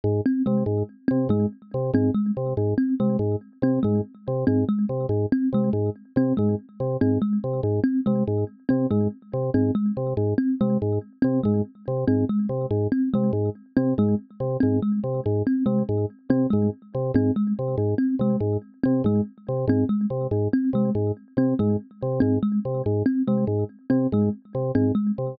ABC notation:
X:1
M:3/4
L:1/8
Q:1/4=142
K:none
V:1 name="Drawbar Organ" clef=bass
_A,, z C, A,, z C, | _A,, z C, A,, z C, | _A,, z C, A,, z C, | _A,, z C, A,, z C, |
_A,, z C, A,, z C, | _A,, z C, A,, z C, | _A,, z C, A,, z C, | _A,, z C, A,, z C, |
_A,, z C, A,, z C, | _A,, z C, A,, z C, | _A,, z C, A,, z C, | _A,, z C, A,, z C, |
_A,, z C, A,, z C, | _A,, z C, A,, z C, | _A,, z C, A,, z C, | _A,, z C, A,, z C, |
_A,, z C, A,, z C, | _A,, z C, A,, z C, | _A,, z C, A,, z C, | _A,, z C, A,, z C, |]
V:2 name="Kalimba"
z C _A, z2 C | _A, z2 C A, z | z C _A, z2 C | _A, z2 C A, z |
z C _A, z2 C | _A, z2 C A, z | z C _A, z2 C | _A, z2 C A, z |
z C _A, z2 C | _A, z2 C A, z | z C _A, z2 C | _A, z2 C A, z |
z C _A, z2 C | _A, z2 C A, z | z C _A, z2 C | _A, z2 C A, z |
z C _A, z2 C | _A, z2 C A, z | z C _A, z2 C | _A, z2 C A, z |]